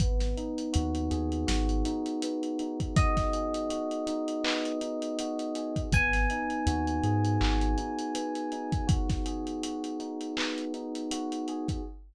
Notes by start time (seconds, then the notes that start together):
0.00 G#1 B3, kick, closed hi-hat
0.20 snare, closed hi-hat
0.37 D#4, closed hi-hat
0.58 closed hi-hat
0.73 D#2 F#4, closed hi-hat
0.95 closed hi-hat
1.11 D#2 G#4, closed hi-hat
1.32 closed hi-hat
1.47 G#1 F#4, snare
1.69 closed hi-hat
1.85 D#4, closed hi-hat
2.06 closed hi-hat
2.22 B3, closed hi-hat
2.43 closed hi-hat
2.59 D#4, closed hi-hat
2.80 kick, closed hi-hat
2.96 F#4 D#5, kick, closed hi-hat
3.17 kick, snare, closed hi-hat
3.33 G#4, closed hi-hat
3.54 closed hi-hat
3.70 F#4, closed hi-hat
3.91 closed hi-hat
4.07 D#4, closed hi-hat
4.28 closed hi-hat
4.44 B3, clap
4.65 closed hi-hat
4.81 D#4, closed hi-hat
5.02 closed hi-hat
5.19 F#4, closed hi-hat
5.39 closed hi-hat
5.55 G#4, closed hi-hat
5.76 kick, closed hi-hat
5.92 G#1 B3 G#5, kick, closed hi-hat
6.13 snare, closed hi-hat
6.30 D#4, closed hi-hat
6.50 closed hi-hat
6.67 D#2 F#4, closed hi-hat
6.87 closed hi-hat
7.03 G#2 G#4, closed hi-hat
7.25 closed hi-hat
7.40 G#1 F#4, clap
7.61 closed hi-hat
7.78 D#4, closed hi-hat
7.99 closed hi-hat
8.15 B3, closed hi-hat
8.35 closed hi-hat
8.52 D#4, closed hi-hat
8.72 kick, closed hi-hat
8.87 F#4, kick, closed hi-hat
9.09 kick, snare, closed hi-hat
9.26 G#4, closed hi-hat
9.47 closed hi-hat
9.63 F#4, closed hi-hat
9.84 closed hi-hat
10.00 D#4, closed hi-hat
10.21 closed hi-hat
10.37 B3, clap
10.58 closed hi-hat
10.74 D#4, closed hi-hat
10.95 closed hi-hat
11.11 F#4, closed hi-hat
11.32 closed hi-hat
11.48 G#4, closed hi-hat
11.68 kick, closed hi-hat